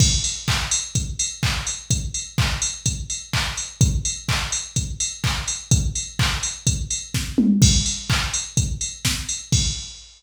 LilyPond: \new DrumStaff \drummode { \time 4/4 \tempo 4 = 126 <cymc bd>8 hho8 <hc bd>8 hho8 <hh bd>8 hho8 <hc bd>8 hho8 | <hh bd>8 hho8 <hc bd>8 hho8 <hh bd>8 hho8 <hc bd>8 hho8 | <hh bd>8 hho8 <hc bd>8 hho8 <hh bd>8 hho8 <hc bd>8 hho8 | <hh bd>8 hho8 <hc bd>8 hho8 <hh bd>8 hho8 <bd sn>8 toml8 |
<cymc bd>8 hho8 <hc bd>8 hho8 <hh bd>8 hho8 <bd sn>8 hho8 | <cymc bd>4 r4 r4 r4 | }